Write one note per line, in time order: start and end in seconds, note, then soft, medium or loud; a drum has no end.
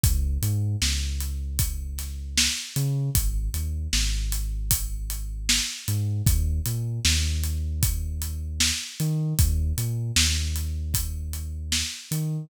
0.04 0.38 C#2 medium
0.04 kick medium
0.04 closed hi-hat medium
0.42 0.76 G#2 medium
0.42 closed hi-hat medium
0.82 2.48 C#2 medium
0.82 snare medium
1.21 closed hi-hat medium
1.59 kick medium
1.59 closed hi-hat medium
1.98 snare soft
1.98 closed hi-hat medium
2.38 snare loud
2.76 3.10 C#3 medium
2.76 closed hi-hat medium
3.15 3.49 G#1 medium
3.15 kick medium
3.15 closed hi-hat medium
3.54 3.88 D#2 medium
3.54 closed hi-hat medium
3.93 5.60 G#1 medium
3.93 snare medium
4.32 closed hi-hat medium
4.71 kick medium
4.71 closed hi-hat loud
5.10 closed hi-hat medium
5.49 snare loud
5.88 6.22 G#2 medium
5.88 closed hi-hat medium
6.26 6.60 D#2 medium
6.26 kick medium
6.26 closed hi-hat medium
6.66 7.00 A#2 medium
6.66 closed hi-hat medium
7.05 8.72 D#2 medium
7.05 snare medium
7.44 closed hi-hat medium
7.83 kick medium
7.83 closed hi-hat medium
8.22 closed hi-hat medium
8.60 snare loud
9.00 9.34 D#3 medium
9.00 closed hi-hat medium
9.39 9.73 D#2 loud
9.39 kick medium
9.39 closed hi-hat medium
9.78 10.12 A#2 medium
9.78 closed hi-hat medium
10.16 11.83 D#2 medium
10.16 snare loud
10.56 closed hi-hat medium
10.94 kick medium
10.94 closed hi-hat medium
11.33 closed hi-hat soft
11.72 snare medium
12.11 12.45 D#3 medium
12.11 closed hi-hat medium